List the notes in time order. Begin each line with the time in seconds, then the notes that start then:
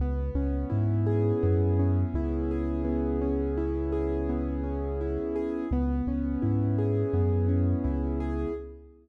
0.00 C#2 B3
0.35 C#2 C#4
0.70 G#2 E4
1.06 G#4
1.43 F#2 B3
1.79 C#4
2.14 C#2 E4
2.51 G#4
2.84 B3
3.21 C#4
3.57 E4
3.92 G#4
4.29 B3
4.64 C#4
5.01 E4
5.36 G#4
5.71 C#2 B3
6.07 C#2 C#4
6.42 G#2 E4
6.78 G#4
7.13 F#2 B3
7.48 C#4
7.84 C#2 E4
8.20 G#4